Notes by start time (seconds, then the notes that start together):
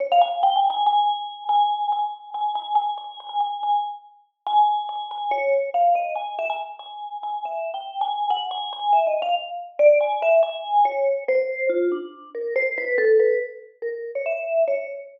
0.00 C#5
0.12 F5
0.21 G#5
0.43 G5
0.56 G#5
0.70 G#5
0.86 G#5
1.49 G#5
1.92 G#5
2.34 G#5
2.55 G#5
2.75 G#5
2.98 G#5
3.20 G#5
3.29 G#5
3.40 G#5
3.63 G#5
4.46 G#5
4.89 G#5
5.11 G#5
5.31 C#5
5.74 F5
5.95 D#5
6.15 G#5
6.38 E5
6.49 G#5
6.79 G#5
7.23 G#5
7.45 E5
7.74 G5
8.01 G#5
8.30 F#5
8.51 G#5
8.72 G#5
8.92 E5
9.06 D#5
9.22 F5
9.79 D5
10.00 G#5
10.22 E5
10.43 G#5
10.85 C#5
11.28 C5
11.69 F4
11.91 D4
12.34 A#4
12.56 C5
12.78 B4
12.98 A4
13.19 B4
13.82 A#4
14.15 C#5
14.25 E5
14.67 C#5